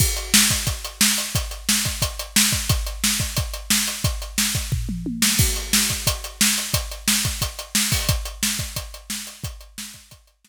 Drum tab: CC |x-------|--------|--------|--------|
HH |-x-xxx-x|xx-xxx-x|xx-xxx-x|xx-x----|
SD |--o---o-|--o---o-|--o---o-|--o----o|
T1 |--------|--------|--------|------o-|
T2 |--------|--------|--------|-----o--|
FT |--------|--------|--------|----o---|
BD |o--oo---|o--oo--o|o--oo---|o--oo---|

CC |x-------|--------|--------|--------|
HH |-x-xxx-x|xx-xxx-o|xx-xxx-x|xx-xxx--|
SD |--o---o-|--o---o-|--o---o-|--o---o-|
T1 |--------|--------|--------|--------|
T2 |--------|--------|--------|--------|
FT |--------|--------|--------|--------|
BD |o--oo---|o--oo--o|o--oo---|o--oo---|